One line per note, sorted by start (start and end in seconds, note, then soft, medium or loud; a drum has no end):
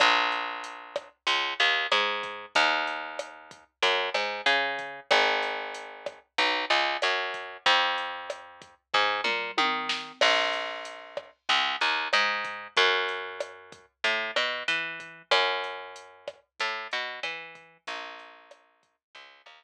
0.00 1.09 A#1 medium
0.00 kick loud
0.00 cross-stick medium
0.00 closed hi-hat loud
0.32 closed hi-hat medium
0.64 closed hi-hat loud
0.96 kick medium
0.96 cross-stick medium
0.96 closed hi-hat medium
1.27 1.54 C#2 medium
1.27 kick medium
1.27 closed hi-hat loud
1.60 1.87 D#2 medium
1.60 closed hi-hat medium
1.91 2.46 G#2 medium
1.91 cross-stick medium
1.91 closed hi-hat loud
2.23 kick medium
2.23 closed hi-hat medium
2.55 3.64 D#2 medium
2.55 kick loud
2.55 closed hi-hat loud
2.87 closed hi-hat medium
3.19 cross-stick medium
3.19 closed hi-hat loud
3.51 kick medium
3.51 closed hi-hat medium
3.82 4.10 F#2 medium
3.82 kick medium
3.82 closed hi-hat loud
4.14 4.41 G#2 medium
4.14 cross-stick medium
4.14 closed hi-hat medium
4.46 5.00 C#3 medium
4.46 closed hi-hat loud
4.79 kick medium
4.79 closed hi-hat medium
5.11 6.19 G#1 medium
5.11 kick loud
5.11 cross-stick loud
5.11 closed hi-hat loud
5.43 closed hi-hat medium
5.74 closed hi-hat loud
6.06 kick medium
6.06 cross-stick medium
6.06 closed hi-hat medium
6.38 6.65 B1 medium
6.38 kick medium
6.38 closed hi-hat loud
6.70 6.97 C#2 medium
6.70 closed hi-hat medium
7.02 7.57 F#2 medium
7.02 cross-stick medium
7.02 closed hi-hat loud
7.34 kick medium
7.34 closed hi-hat medium
7.66 8.75 F2 medium
7.66 kick loud
7.66 closed hi-hat loud
7.98 closed hi-hat medium
8.30 cross-stick medium
8.30 closed hi-hat loud
8.62 kick medium
8.62 closed hi-hat medium
8.94 9.21 G#2 medium
8.94 kick medium
8.94 floor tom medium
9.24 9.51 A#2 medium
9.24 mid tom medium
9.58 10.12 D#3 medium
9.58 high tom medium
9.89 snare loud
10.21 11.31 A#1 medium
10.21 kick loud
10.21 cross-stick loud
10.21 crash loud
10.53 closed hi-hat medium
10.85 closed hi-hat loud
11.17 kick medium
11.17 cross-stick medium
11.49 11.76 C#2 medium
11.49 kick medium
11.49 closed hi-hat medium
11.81 12.08 D#2 medium
11.81 closed hi-hat medium
12.13 12.68 G#2 medium
12.13 cross-stick medium
12.13 closed hi-hat medium
12.45 kick medium
12.45 closed hi-hat medium
12.77 13.86 F#2 medium
12.77 kick medium
12.77 closed hi-hat loud
13.09 closed hi-hat medium
13.40 cross-stick medium
13.40 closed hi-hat loud
13.72 kick medium
13.72 closed hi-hat medium
14.04 14.31 A2 medium
14.04 kick medium
14.04 closed hi-hat loud
14.36 14.63 B2 medium
14.36 cross-stick medium
14.36 closed hi-hat medium
14.68 15.22 E3 medium
14.68 closed hi-hat loud
15.00 kick medium
15.00 closed hi-hat medium
15.31 16.40 F#2 medium
15.31 kick medium
15.31 cross-stick loud
15.31 closed hi-hat loud
15.64 closed hi-hat medium
15.96 closed hi-hat loud
16.28 kick medium
16.28 cross-stick medium
16.28 closed hi-hat medium
16.60 16.88 A2 medium
16.60 kick medium
16.60 closed hi-hat loud
16.91 17.20 B2 medium
16.91 closed hi-hat medium
17.23 17.78 E3 medium
17.23 cross-stick medium
17.23 closed hi-hat loud
17.55 kick medium
17.55 closed hi-hat medium
17.87 18.96 A#1 medium
17.87 kick medium
17.87 closed hi-hat loud
18.19 closed hi-hat medium
18.51 cross-stick medium
18.51 closed hi-hat loud
18.83 kick medium
18.83 closed hi-hat medium
19.15 19.42 C#2 medium
19.15 kick medium
19.15 closed hi-hat loud
19.46 19.64 D#2 medium
19.46 cross-stick medium
19.46 closed hi-hat medium